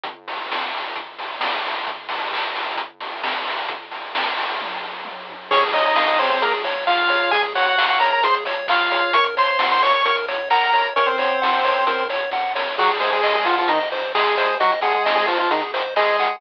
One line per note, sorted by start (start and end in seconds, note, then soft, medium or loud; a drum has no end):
0.04 kick medium
0.04 closed hi-hat medium
0.28 open hi-hat medium
0.51 kick medium
0.51 snare medium
0.74 open hi-hat medium
0.96 kick medium
0.96 closed hi-hat medium
1.19 open hi-hat medium
1.40 kick medium
1.40 snare medium
1.66 open hi-hat medium
1.87 kick medium
1.87 closed hi-hat medium
2.09 open hi-hat medium
2.32 kick medium
2.32 clap medium
2.55 open hi-hat medium
2.76 kick medium
2.76 closed hi-hat medium
3.00 open hi-hat medium
3.23 kick medium
3.23 snare medium
3.48 open hi-hat medium
3.68 kick medium
3.68 closed hi-hat medium
3.91 open hi-hat medium
4.15 kick medium
4.15 snare loud
4.37 open hi-hat medium
4.60 kick medium
4.60 high tom medium
4.81 floor tom medium
5.05 high tom medium
5.30 floor tom medium
5.51 7.19 C#2 medium
5.51 5.62 C#4 medium
5.51 5.71 G#4 medium
5.51 5.62 C#5 medium
5.51 kick loud
5.51 crash medium
5.62 closed hi-hat medium
5.73 5.84 D#4 medium
5.73 5.94 C#5 medium
5.73 5.84 D#5 medium
5.73 open hi-hat medium
5.85 6.07 D#4 medium
5.85 6.07 D#5 medium
5.85 closed hi-hat medium
5.96 6.16 F5 medium
5.96 kick medium
5.96 snare medium
6.08 6.19 D#4 medium
6.08 6.19 D#5 medium
6.08 closed hi-hat medium
6.18 6.30 C4 medium
6.18 6.30 C5 medium
6.18 6.39 C#5 medium
6.18 snare soft
6.18 open hi-hat medium
6.30 6.41 C4 medium
6.30 6.41 C5 medium
6.30 closed hi-hat medium
6.41 6.53 A#3 soft
6.41 6.62 G#4 medium
6.41 6.53 A#4 medium
6.41 kick medium
6.41 closed hi-hat medium
6.52 closed hi-hat medium
6.64 6.85 C#5 medium
6.64 open hi-hat medium
6.75 closed hi-hat medium
6.87 7.31 F4 medium
6.87 7.31 F5 medium
6.87 7.08 F5 medium
6.87 kick medium
6.87 clap medium
6.98 closed hi-hat medium
7.08 7.30 C#5 medium
7.08 open hi-hat medium
7.21 closed hi-hat medium
7.31 8.99 C#2 medium
7.31 7.42 G#4 medium
7.31 7.53 G#4 medium
7.31 7.42 G#5 medium
7.31 kick medium
7.31 closed hi-hat medium
7.43 closed hi-hat medium
7.55 7.66 F#4 medium
7.55 7.76 C#5 medium
7.55 7.66 F#5 medium
7.55 open hi-hat medium
7.66 7.85 F#4 medium
7.66 7.85 F#5 medium
7.66 closed hi-hat medium
7.76 7.98 F5 medium
7.76 kick medium
7.76 clap loud
7.88 7.99 F#4 medium
7.88 7.99 F#5 medium
7.88 closed hi-hat medium
7.99 8.11 A#4 medium
7.99 8.21 C#5 medium
7.99 8.11 A#5 medium
7.99 snare soft
7.99 open hi-hat medium
8.12 8.23 A#4 medium
8.12 8.23 A#5 medium
8.12 closed hi-hat medium
8.22 8.44 G#4 medium
8.22 8.35 C5 medium
8.22 8.35 C6 medium
8.22 kick medium
8.22 closed hi-hat loud
8.34 closed hi-hat medium
8.45 8.67 C#5 medium
8.45 open hi-hat medium
8.56 closed hi-hat medium
8.68 9.14 F4 medium
8.68 8.89 F5 medium
8.68 9.14 F5 medium
8.68 kick medium
8.68 clap loud
8.81 closed hi-hat medium
8.91 9.12 C#5 medium
8.91 open hi-hat medium
9.02 closed hi-hat medium
9.13 10.80 F#2 medium
9.13 9.35 A#4 medium
9.13 9.25 C#5 medium
9.13 9.25 C#6 medium
9.13 kick medium
9.13 closed hi-hat loud
9.24 closed hi-hat medium
9.37 9.48 C5 medium
9.37 9.57 C#5 medium
9.37 9.48 C6 medium
9.37 open hi-hat medium
9.48 9.67 C5 medium
9.48 9.67 C6 medium
9.48 closed hi-hat medium
9.59 9.80 F#5 medium
9.59 kick medium
9.59 snare loud
9.71 9.82 C5 medium
9.71 9.82 C6 medium
9.71 closed hi-hat medium
9.81 10.03 C#5 medium
9.81 9.93 C#5 medium
9.81 9.93 C#6 medium
9.81 snare soft
9.81 open hi-hat medium
9.93 10.05 C#5 medium
9.93 10.05 C#6 medium
9.93 closed hi-hat medium
10.05 10.25 A#4 medium
10.05 10.16 C#5 medium
10.05 10.16 C#6 medium
10.05 kick medium
10.05 closed hi-hat medium
10.17 closed hi-hat medium
10.28 10.49 C#5 medium
10.28 open hi-hat medium
10.38 closed hi-hat medium
10.50 10.87 A#4 medium
10.50 10.71 F#5 medium
10.50 10.87 A#5 medium
10.50 kick medium
10.50 clap medium
10.63 closed hi-hat medium
10.73 10.94 C#5 medium
10.73 open hi-hat medium
10.84 closed hi-hat medium
10.96 12.64 F#2 medium
10.96 11.07 C#4 medium
10.96 11.17 A#4 medium
10.96 11.07 C#5 medium
10.96 kick medium
10.96 closed hi-hat medium
11.06 12.04 C4 soft
11.06 12.04 C5 medium
11.06 closed hi-hat medium
11.18 11.39 C#5 medium
11.18 open hi-hat medium
11.30 closed hi-hat medium
11.42 11.62 F#5 medium
11.42 kick medium
11.42 snare medium
11.53 closed hi-hat medium
11.64 11.85 C#5 medium
11.64 snare soft
11.64 open hi-hat medium
11.76 closed hi-hat medium
11.87 12.07 A#4 medium
11.87 kick medium
11.87 closed hi-hat loud
11.98 closed hi-hat medium
12.09 12.30 C#5 medium
12.09 open hi-hat medium
12.22 closed hi-hat medium
12.31 12.53 F#5 medium
12.31 kick medium
12.31 snare medium
12.55 12.75 C#5 medium
12.55 snare medium
12.77 14.44 G#1 loud
12.77 12.90 F#3 medium
12.77 12.90 F#4 medium
12.77 12.98 G#4 medium
12.77 kick medium
12.77 crash medium
12.91 closed hi-hat medium
13.00 13.11 G#3 soft
13.00 13.11 G#4 medium
13.00 13.21 C5 medium
13.00 open hi-hat medium
13.12 13.34 G#3 medium
13.12 13.34 G#4 medium
13.12 closed hi-hat medium
13.23 13.44 D#5 medium
13.23 kick medium
13.23 clap medium
13.35 13.46 G#3 medium
13.35 13.46 G#4 medium
13.35 closed hi-hat medium
13.45 13.56 F3 medium
13.45 13.56 F4 medium
13.45 13.67 F#5 medium
13.45 snare medium
13.45 open hi-hat medium
13.57 13.69 F3 medium
13.57 13.69 F4 medium
13.57 closed hi-hat medium
13.68 13.79 D#3 medium
13.68 13.79 D#4 medium
13.68 13.89 D#5 medium
13.68 kick medium
13.68 closed hi-hat medium
13.80 closed hi-hat medium
13.91 14.12 C5 medium
13.91 open hi-hat medium
14.04 closed hi-hat medium
14.15 14.55 G#3 medium
14.15 14.35 G#4 medium
14.15 14.55 G#4 medium
14.15 kick medium
14.15 clap loud
14.27 closed hi-hat medium
14.37 14.58 C5 medium
14.37 open hi-hat medium
14.50 closed hi-hat medium
14.60 16.27 G#1 medium
14.60 14.71 F#3 medium
14.60 14.71 F#4 medium
14.60 14.80 D#5 medium
14.60 kick medium
14.60 closed hi-hat medium
14.72 closed hi-hat medium
14.81 14.93 G#3 medium
14.81 14.93 G#4 medium
14.81 15.03 F#5 medium
14.81 open hi-hat medium
14.94 15.15 G#3 soft
14.94 15.15 G#4 medium
14.94 closed hi-hat medium
15.04 15.26 D#5 medium
15.04 kick medium
15.04 snare medium
15.16 15.26 G#3 medium
15.16 15.26 G#4 medium
15.27 15.38 F3 soft
15.27 15.38 F4 medium
15.27 15.48 C5 medium
15.27 snare medium
15.27 open hi-hat medium
15.39 15.50 F3 soft
15.39 15.50 F4 medium
15.39 closed hi-hat medium
15.51 15.62 D#3 soft
15.51 15.62 D#4 medium
15.51 15.71 G#4 medium
15.51 kick medium
15.51 closed hi-hat medium
15.62 closed hi-hat medium
15.73 15.94 C5 medium
15.73 open hi-hat medium
15.84 closed hi-hat medium
15.96 16.36 G#3 medium
15.96 16.36 G#4 medium
15.96 16.16 D#5 medium
15.96 kick medium
15.96 clap medium
16.08 closed hi-hat medium
16.19 16.40 F#5 medium
16.19 open hi-hat medium
16.29 closed hi-hat medium